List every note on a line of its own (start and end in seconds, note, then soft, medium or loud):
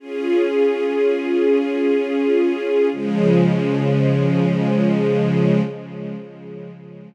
0.00 2.89 C#4 medium
0.00 2.89 F4 medium
0.00 2.89 G#4 loud
2.92 5.61 C#3 loud
2.92 5.61 F3 loud
2.92 5.61 G#3 loud